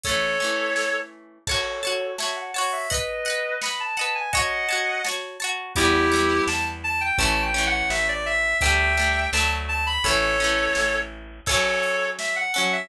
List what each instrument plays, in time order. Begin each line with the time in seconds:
0.03 acoustic guitar (steel) A3 C#4, clarinet A4 C#5, kick, closed hi-hat
0.09 acoustic guitar (steel) E3
0.40 acoustic guitar (steel) A3 C#4
0.44 acoustic guitar (steel) E3
0.76 snare
1.47 clarinet A4 C#5, acoustic guitar (steel) C#5 A5, kick, crash
1.51 acoustic guitar (steel) F#4
1.83 acoustic guitar (steel) F#4 C#5 A5, closed hi-hat
2.18 acoustic guitar (steel) C#5 A5, clarinet E5, snare
2.22 acoustic guitar (steel) F#4
2.36 clarinet F#5
2.54 acoustic guitar (steel) F#4 C#5 A5, clarinet F#5, open hi-hat
2.72 clarinet E5
2.90 clarinet B4 D#5, acoustic guitar (steel) D#5 F#5, kick, closed hi-hat
2.94 acoustic guitar (steel) B4
3.25 acoustic guitar (steel) D#5 F#5, closed hi-hat
3.30 acoustic guitar (steel) B4
3.61 acoustic guitar (steel) D#5 F#5, clarinet B5, snare
3.66 acoustic guitar (steel) B4
3.80 clarinet A5
3.97 acoustic guitar (steel) D#5 F#5, clarinet A5, closed hi-hat
4.01 acoustic guitar (steel) B4
4.15 clarinet G#5
4.33 acoustic guitar (steel) C#5 A5, clarinet D#5 F#5, kick, closed hi-hat
4.37 acoustic guitar (steel) F#4
4.69 acoustic guitar (steel) F#4 C#5 A5, closed hi-hat
5.04 acoustic guitar (steel) C#5 A5, snare
5.08 acoustic guitar (steel) F#4
5.40 acoustic guitar (steel) C#5 A5, closed hi-hat
5.44 acoustic guitar (steel) F#4
5.75 electric bass (finger) E2, acoustic guitar (steel) G3 B3, clarinet E4 G4, kick, closed hi-hat
5.80 acoustic guitar (steel) E3
6.12 acoustic guitar (steel) E3 G3 B3
6.47 electric bass (finger) E2, clarinet A5, snare
6.84 clarinet A5
7.01 clarinet G5
7.18 electric bass (finger) A1, acoustic guitar (steel) A3 C#4, clarinet A5, kick, closed hi-hat
7.22 acoustic guitar (steel) E3
7.42 clarinet G5
7.54 acoustic guitar (steel) A3 C#4
7.58 acoustic guitar (steel) E3
7.67 clarinet F#5
7.90 electric bass (finger) A1, clarinet E5, snare
8.08 clarinet D5
8.26 clarinet E5
8.61 electric bass (finger) D2, acoustic guitar (steel) A3 D4, clarinet E5 G5, kick, closed hi-hat
8.65 acoustic guitar (steel) G3
8.97 acoustic guitar (steel) A3 D4
9.01 acoustic guitar (steel) G3
9.33 electric bass (finger) D2, acoustic guitar (steel) A3 D4, clarinet A5, snare
9.37 acoustic guitar (steel) F#3
9.68 clarinet A5
9.86 clarinet B5
10.04 electric bass (finger) A1, acoustic guitar (steel) A3 C#4, clarinet A4 C#5, kick, closed hi-hat
10.08 acoustic guitar (steel) E3
10.40 acoustic guitar (steel) A3 C#4
10.44 acoustic guitar (steel) E3
10.75 electric bass (finger) A1, snare
11.46 acoustic guitar (steel) C#4 A4, clarinet A4 C#5, kick, crash
11.51 acoustic guitar (steel) F#3
11.83 closed hi-hat
12.19 clarinet E5, snare
12.36 clarinet F#5
12.54 acoustic guitar (steel) F#3 C#4 A4, clarinet F#5, closed hi-hat
12.72 clarinet E5